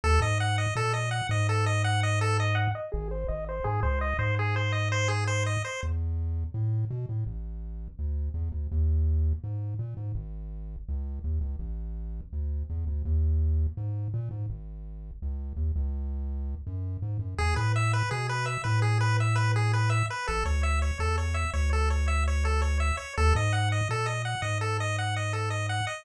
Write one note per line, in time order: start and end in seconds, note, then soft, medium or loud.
0.04 0.19 D#2 loud
0.04 0.20 A4 loud
0.20 0.66 G#2 loud
0.20 0.38 D#5 medium
0.40 0.56 F#5 medium
0.58 0.74 D#5 medium
0.76 1.22 A#2 medium
0.76 0.93 A4 medium
0.93 1.10 D#5 medium
1.11 1.27 F#5 medium
1.29 2.68 G#2 loud
1.29 1.47 D#5 medium
1.49 1.65 A4 medium
1.66 1.83 D#5 medium
1.84 2.01 F#5 medium
2.03 2.19 D#5 medium
2.21 2.37 A4 medium
2.40 2.56 D#5 medium
2.55 2.71 F#5 medium
2.75 2.91 D#5 medium
2.92 3.24 G#1 loud
2.92 3.08 G#4 medium
3.11 3.27 C5 medium
3.28 3.60 G#1 loud
3.28 3.45 D#5 medium
3.49 3.65 C5 medium
3.64 3.81 G#2 medium
3.64 3.80 G#4 medium
3.83 4.14 C#2 loud
3.83 3.99 C5 medium
4.01 4.17 D#5 medium
4.19 5.57 G#2 loud
4.19 4.35 C5 medium
4.39 4.55 G#4 medium
4.56 4.72 C5 medium
4.72 4.89 D#5 medium
4.92 5.08 C5 medium
5.08 5.24 G#4 medium
5.27 5.44 C5 medium
5.46 5.63 D#5 medium
5.65 5.81 C5 medium
5.83 6.44 E2 medium
6.54 6.85 A2 medium
6.91 7.06 B2 medium
7.09 7.24 A2 medium
7.26 7.88 A1 medium
7.99 8.30 D2 medium
8.34 8.49 E2 medium
8.52 8.67 D2 medium
8.72 9.33 D#2 loud
9.44 9.74 G#2 medium
9.79 9.94 A#2 medium
9.97 10.12 G#2 medium
10.15 10.76 G#1 loud
10.88 11.19 C#2 medium
11.24 11.39 D#2 medium
11.41 11.56 C#2 medium
11.59 12.21 A1 loud
12.33 12.63 D2 medium
12.70 12.85 E2 medium
12.87 13.02 D2 medium
13.05 13.67 D#2 loud
13.77 14.08 G#2 medium
14.14 14.29 A#2 medium
14.31 14.46 G#2 medium
14.50 15.11 G#1 medium
15.22 15.53 C#2 medium
15.57 15.72 D#2 medium
15.76 16.55 C#2 loud
16.67 16.97 F#2 medium
17.02 17.18 G#2 medium
17.19 17.35 F#2 medium
17.38 17.54 E2 loud
17.38 17.55 G#4 medium
17.56 18.03 A2 medium
17.56 17.72 B4 medium
17.76 17.92 E5 medium
17.93 18.10 B4 medium
18.11 18.58 B2 medium
18.11 18.27 G#4 medium
18.29 18.46 B4 medium
18.46 18.62 E5 medium
18.64 20.03 A2 loud
18.64 18.80 B4 medium
18.82 18.98 G#4 medium
19.01 19.17 B4 medium
19.20 19.36 E5 medium
19.35 19.52 B4 medium
19.56 19.72 G#4 medium
19.73 19.90 B4 medium
19.90 20.06 E5 medium
20.10 20.27 B4 medium
20.27 20.44 A1 loud
20.27 20.44 A4 medium
20.45 20.91 D2 loud
20.45 20.62 C#5 medium
20.63 20.79 E5 medium
20.82 20.98 C#5 medium
20.99 21.45 E2 loud
20.99 21.16 A4 medium
21.18 21.34 C#5 medium
21.34 21.51 E5 medium
21.53 22.92 D2 loud
21.53 21.70 C#5 medium
21.73 21.89 A4 medium
21.90 22.06 C#5 medium
22.08 22.24 E5 medium
22.28 22.44 C#5 medium
22.45 22.61 A4 medium
22.62 22.78 C#5 medium
22.80 22.96 E5 medium
22.97 23.13 C#5 medium
23.17 23.33 D#2 loud
23.17 23.34 A4 loud
23.35 23.81 G#2 loud
23.35 23.52 D#5 medium
23.53 23.69 F#5 medium
23.72 23.88 D#5 medium
23.89 24.35 A#2 medium
23.89 24.07 A4 medium
24.06 24.22 D#5 medium
24.25 24.41 F#5 medium
24.42 25.81 G#2 medium
24.42 24.58 D#5 medium
24.61 24.77 A4 medium
24.80 24.96 D#5 medium
24.98 25.15 F#5 medium
25.16 25.33 D#5 medium
25.33 25.49 A4 medium
25.50 25.67 D#5 medium
25.69 25.85 F#5 medium
25.87 26.03 D#5 medium